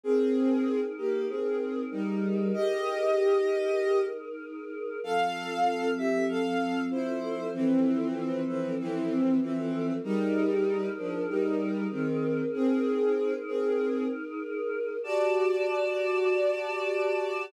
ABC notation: X:1
M:4/4
L:1/8
Q:1/4=96
K:F
V:1 name="Violin"
[C_A]3 [B,G] [CA]2 [G,_E]2 | [G_e]5 z3 | [Af]3 [Ge] [Af]2 [Ec]2 | [E,C]3 [E,C] [E,C]2 [E,C]2 |
[G,_E]3 [F,D] [G,E]2 [_E,C]2 | [C_A]3 [CA]2 z3 | [K:G] [Fd]8 |]
V:2 name="Choir Aahs"
[_E_AB]8- | [_E_AB]8 | [F,CA]8- | [F,CA]8 |
[_E_AB]8- | [_E_AB]8 | [K:G] [Gda]8 |]